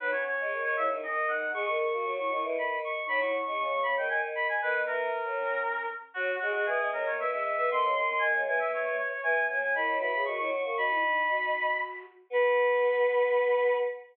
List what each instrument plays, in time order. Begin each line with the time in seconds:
0.00 choir aahs F#3, flute D#4, clarinet B4
0.12 flute C#4, clarinet C#5
0.27 clarinet C#5
0.40 choir aahs G#3
0.51 choir aahs D#3
0.63 clarinet C#5
0.76 choir aahs C#3, flute E4, clarinet E5
0.89 choir aahs D#3, flute D#4
1.02 choir aahs D#3, flute C#4, clarinet D#5
1.28 flute D#4, clarinet F#5
1.53 choir aahs G#3, flute G#4, clarinet C#6
1.66 flute A#4, clarinet C#6
1.78 clarinet C#6
1.93 choir aahs A#3, flute F#4
2.05 choir aahs F#3, flute F#4
2.18 flute E4, clarinet C#6
2.30 choir aahs D#3, flute E4, clarinet C#6
2.43 choir aahs E3, flute E4
2.56 choir aahs D#3, clarinet B5
2.84 clarinet C#6
3.06 choir aahs F#3, flute D#4, clarinet B5
3.20 flute E4, clarinet C#6
3.45 choir aahs G#3, flute C#4, clarinet C#6
3.59 choir aahs C#3, flute C#4, clarinet C#6
3.71 flute B3, clarinet C#6
3.83 choir aahs C#3, flute B3, clarinet B5
3.97 choir aahs D#3, flute B3, clarinet G5
4.09 choir aahs D#3, clarinet G#5
4.35 clarinet B5
4.49 clarinet G#5
4.62 choir aahs D#3, flute B3, clarinet B4
4.86 choir aahs E3, clarinet A#4
5.25 choir aahs F#3
5.38 flute C#4
6.14 choir aahs F#3, clarinet F#4, flute F#4
6.40 choir aahs G#3, clarinet F#4, flute G#4
6.53 clarinet F#4, flute G#4
6.65 choir aahs E3, flute B3, clarinet G#4
6.80 choir aahs G#3
6.92 choir aahs F#3, flute B3, clarinet A#4
7.04 choir aahs D#3, flute A#3, clarinet C#5
7.18 choir aahs E3, flute B3, clarinet E5
7.30 choir aahs G#3, flute C#4, clarinet E5
7.45 clarinet E5
7.57 choir aahs B3, clarinet E5
7.69 choir aahs D#3, flute C4, clarinet C6
7.82 choir aahs C#3
7.95 choir aahs D#3, flute C#4, clarinet C6
8.07 flute C#4, clarinet C6
8.19 choir aahs D#3, flute A#3, clarinet G#5
8.34 choir aahs C#3
8.45 choir aahs E3, flute A#3, clarinet G#5
8.58 flute A#3, clarinet E5
8.71 flute A#3, clarinet C#5
8.85 flute A#3, clarinet C#5
8.98 clarinet C#5
9.09 clarinet C#5
9.23 choir aahs E3, flute B3, clarinet G#5
9.47 choir aahs F#3, flute A#3, clarinet G#5
9.60 flute A#3, clarinet G#5
9.74 choir aahs D#3, flute E4, clarinet B5
9.88 choir aahs F#3
9.99 choir aahs E3, flute F#4, clarinet B5
10.11 choir aahs C#3, flute G#4, clarinet B5
10.25 choir aahs D#3, flute F#4, clarinet C#6
10.38 choir aahs F#3, flute E4, clarinet C#6
10.51 clarinet C#6
10.62 choir aahs A#3, clarinet C#6
10.77 choir aahs D#4, flute F#4, clarinet B5
10.91 flute E4
11.02 flute D#4
11.29 flute F#4
12.30 choir aahs B3, flute B4, clarinet B5